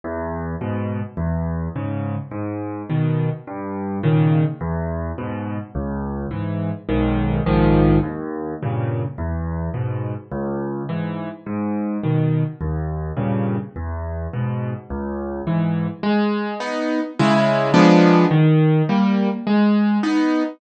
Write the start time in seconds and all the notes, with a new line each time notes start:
0.04 E2
0.61 G#2 B2
1.17 E2
1.76 G#2 C#3
2.31 G#2
2.90 B2 D#3
3.47 G2
4.03 A#2 C#3 D#3
4.61 E2
5.18 G#2 B2
5.75 C#2
6.31 G#2 E3
6.89 B1 G#2 D#3
7.46 A#1 G#2 D#3 F3
8.03 D#2
8.62 G2 A#2 C#3
9.18 E2
9.74 G#2 B2
10.32 C#2
10.89 G#2 E3
11.46 G#2
12.03 B2 D#3
12.61 D#2
13.17 G2 A#2 C#3
13.76 E2
14.33 G#2 B2
14.90 C#2
15.47 G#2 E3
16.03 G#3
16.60 B3 D#4
17.19 C#3 G#3 E4
17.74 F3 G#3 B3 D4
18.31 D#3
18.89 G3 A#3
19.47 G#3
20.03 B3 D#4